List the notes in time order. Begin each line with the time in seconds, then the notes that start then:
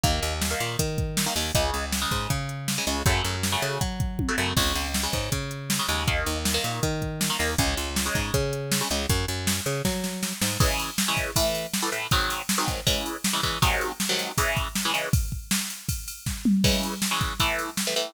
0.04 D#2 D#3 A#3, kick, closed hi-hat
0.22 D#2, closed hi-hat
0.42 snare
0.51 D#3 A#3
0.60 A#2, closed hi-hat
0.79 D#3, kick, closed hi-hat
0.98 kick, closed hi-hat
1.17 snare
1.26 D#3 A#3
1.36 D#2 D#3 A#3, open hi-hat
1.55 C#2 C#3 G#3, kick, closed hi-hat
1.74 C#2, closed hi-hat
1.92 snare
2.02 C#3 G#3
2.11 G#2, kick, closed hi-hat
2.30 C#3, kick, closed hi-hat
2.49 closed hi-hat
2.68 snare
2.78 C#3 G#3
2.87 C#2 C#3 G#3, closed hi-hat
3.06 F#2 C#3 F#3 A3, kick, closed hi-hat
3.24 F#2, closed hi-hat
3.43 snare
3.52 C#3 F#3 A3
3.62 C#3, closed hi-hat
3.81 F#3, kick, closed hi-hat
4.00 kick, closed hi-hat
4.19 kick, high tom
4.29 C#3 F#3 A3
4.38 F#2 C#3 F#3 A3
4.57 C#2 C#3 G#3, kick, crash
4.75 C#2, closed hi-hat
4.94 snare
5.03 C#3 G#3
5.13 G#2, kick, closed hi-hat
5.32 C#3, kick, closed hi-hat
5.51 closed hi-hat
5.70 snare
5.79 C#3 G#3
5.88 D#2 C#3 G#3, closed hi-hat
6.08 D#3 A#3, kick, closed hi-hat
6.26 D#2, closed hi-hat
6.45 snare
6.54 D#3 A#3
6.64 A#2, closed hi-hat
6.83 D#3, kick, closed hi-hat
7.02 kick, closed hi-hat
7.21 snare
7.30 D#3 A#3
7.39 D#2 D#3 A#3, open hi-hat
7.58 C#2 C#3 G#3, kick, closed hi-hat
7.77 C#2, closed hi-hat
7.96 snare
8.06 C#3 G#3
8.15 G#2, kick, closed hi-hat
8.34 C#3, kick, closed hi-hat
8.53 closed hi-hat
8.72 snare
8.81 C#3 G#3
8.90 C#2 C#3 G#3, closed hi-hat
9.09 F#2, kick, closed hi-hat
9.28 F#2, closed hi-hat
9.47 snare
9.66 C#3, closed hi-hat
9.85 F#3, kick, snare
10.04 snare
10.23 snare
10.42 G#2, snare
10.60 C#3 E3 G#3, kick, crash
10.79 ride
10.98 snare
11.08 C#3 E3 G#3
11.17 kick, ride
11.36 A2 E3 A3, kick, ride
11.55 ride
11.74 snare
11.82 A2 E3 A3
11.92 A2 E3 A3, ride
12.11 G#2 D#3 F#3 C4, kick, ride
12.30 ride
12.49 snare
12.58 G#2 D#3 F#3 C4
12.68 kick, ride
12.87 C#3 E3 G#3, kick, ride
13.06 ride
13.24 snare
13.33 C#3 E3 G#3
13.43 C#3 E3 G#3, kick, ride
13.62 G#2 C3 D#3 F#3, kick, ride
13.81 ride
14.00 snare
14.09 G#2 C3 D#3 F#3
14.19 ride
14.38 C#3 E3 G#3, kick, ride
14.57 kick, ride
14.75 snare
14.85 C#3 E3 G#3
14.94 C#3 E3 G#3, ride
15.13 kick, ride
15.32 kick
15.51 snare
15.70 ride
15.89 kick, ride
16.08 ride
16.26 kick, snare
16.45 mid tom
16.64 C#3 E3 G#3, kick, crash
16.83 ride
17.02 snare
17.11 C#3 E3 G#3
17.21 kick, ride
17.40 A2 E3 A3, kick, ride
17.59 ride
17.77 snare
17.87 A2 E3 A3
17.96 A2 E3 A3, ride